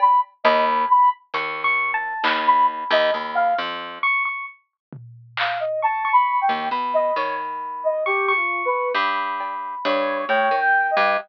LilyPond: <<
  \new Staff \with { instrumentName = "Ocarina" } { \time 5/8 \tempo 4 = 67 b''16 r16 dis''16 r16 b''16 r4 r16 | r16 b''16 r16 dis''16 r16 f''16 r4 | r4 f''16 dis''16 \tuplet 3/2 { a''8 b''8 g''8 } | r16 dis''16 cis''16 r8 dis''16 \tuplet 3/2 { g'8 f'8 b'8 } |
r4 cis''8 \tuplet 3/2 { cis''8 g''8 dis''8 } | }
  \new Staff \with { instrumentName = "Electric Piano 1" } { \time 5/8 r8 b''8 r8 \tuplet 3/2 { cis'''8 cis'''8 a''8 } | b''4. r8 cis'''16 cis'''16 | r4. cis'''16 cis'''8. | b''4. cis'''16 cis'''8. |
b''4. g''4 | }
  \new Staff \with { instrumentName = "Pizzicato Strings" } { \clef bass \time 5/8 r8 dis,8 r8 dis,4 | dis,8. dis,16 dis,8 f,8 r8 | r2 r16 dis,16 | b,8 dis4~ dis16 r8. |
g,4 g,8 a,16 dis8 g,16 | }
  \new DrumStaff \with { instrumentName = "Drums" } \drummode { \time 5/8 cb4. hh4 | hc4. r4 | r8 tomfh8 hc8 r4 | r8 sn4 r4 |
r8 cb8 hh8 r4 | }
>>